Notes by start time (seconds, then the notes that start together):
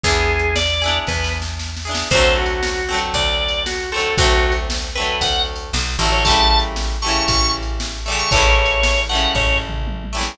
0.03 E2 E4 G#4, kick, closed hi-hat
0.08 B3 D4
0.39 closed hi-hat
0.56 D5, snare
0.82 D4 E4 G#4
0.87 B3, closed hi-hat
1.07 E2 B4, kick, snare
1.24 snare
1.42 snare
1.59 snare
1.77 snare
1.85 D4 E4 G#4
1.91 B3, snare
2.11 D2 A3 C4 C5, kick, crash
2.15 D3 F#3
2.37 F#4
2.46 ride
2.63 snare
2.89 F#3 A3 C4
2.94 D3, ride
3.14 D2 D5, kick, ride
3.48 ride
3.66 F#4, snare
3.92 F#3 A3 C4 A4
3.98 D3, ride
4.17 D2 A3 C4 F#4, kick, ride
4.22 D3 F#3
4.52 ride
4.70 snare
4.95 A3 C4 B4
4.99 D3 F#3
5.04 ride
5.21 D2 F#5, kick, ride
5.56 ride
5.73 B1, snare
5.99 A1 A3 C4
6.03 D3 F#3, ride
6.12 C#5
6.25 E3 G3 A3 A5, kick, ride
6.30 C#3
6.59 ride
6.76 snare
7.02 G3 A3 C#6
7.06 C#3 E3, ride
7.28 A1 C#6, kick, ride
7.62 ride
7.80 snare
8.06 E3 G3 A3
8.12 C#3, ride
8.19 C#6
8.31 A1 G3 A3 C#5, kick, ride
8.36 C#3 E3
8.66 ride
8.83 snare
9.09 E3 G3 A3 F#5
9.15 C#3, ride
9.35 A1 C#5, kick, floor tom
9.53 floor tom
9.69 mid tom
9.87 high tom
10.04 high tom
10.13 E3 G3 A3
10.18 C#3, snare